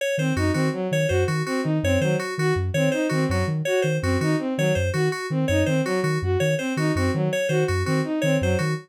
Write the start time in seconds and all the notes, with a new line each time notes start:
0.01 C#5
0.18 D#3 C4 C5
0.36 F#2 D#4 F#4
0.53 D#3 C4 F#4
0.73 F#3
0.91 D#3 C#5
1.08 F#2 F#4 C5
1.28 D#3 F#4
1.46 C4 F#4
1.63 D#3 D#4
1.83 F#2 C4 C#5
2.01 D#3 F#3 C5
2.19 F#4
2.38 D#3 F#4
2.56 F#2
2.74 D#3 C4 C#5
2.92 D#4 C5
3.09 D#3 C4 F#4
3.28 F#2 F#3 F#4
3.47 D#3
3.65 F#4 C#5
3.82 D#3 C5
4.02 F#2 C4 F#4
4.21 D#3 D#4 F#4
4.39 C4
4.57 D#3 F#3 C#5
4.75 F#2 C5
4.94 D#3 F#4
5.12 F#4
5.30 D#3 C4
5.48 F#2 D#4 C#5
5.66 D#3 C4 C5
5.85 F#3 F#4
6.03 D#3 F#4
6.22 F#2 F#4
6.40 D#3 C#5
6.58 C4 C5
6.77 D#3 D#4 F#4
6.95 F#2 C4 F#4
7.14 D#3 F#3
7.33 C#5
7.49 D#3 F#4 C5
7.68 F#2 F#4
7.85 D#3 C4 F#4
8.04 D#4
8.22 D#3 C4 C#5
8.41 F#2 F#3 C5
8.59 D#3 F#4